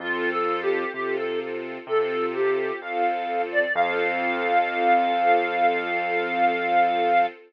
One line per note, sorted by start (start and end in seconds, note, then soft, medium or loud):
0.00 0.85 F2 medium
0.00 0.84 C4 medium
0.00 0.30 F4 medium
0.00 0.84 F4 loud
0.00 0.84 A4 loud
0.31 0.61 A4 medium
0.62 0.92 G4 medium
0.93 1.78 C3 medium
0.93 1.78 C4 medium
0.93 1.78 F4 medium
0.93 1.16 G4 medium
0.93 1.78 A4 medium
1.17 1.39 A4 medium
1.87 2.71 C3 medium
1.87 2.72 C4 medium
1.87 2.72 F4 medium
1.87 2.72 A4 medium
1.87 2.26 A4 medium
2.34 2.80 G4 medium
2.80 3.66 F2 medium
2.80 3.64 C4 medium
2.80 3.64 F4 medium
2.80 3.64 A4 medium
2.80 3.41 F5 medium
3.52 3.74 D5 medium
3.74 7.27 F2 loud
3.74 7.25 C4 loud
3.74 7.25 F4 loud
3.74 7.25 A4 loud
3.74 7.26 F5 loud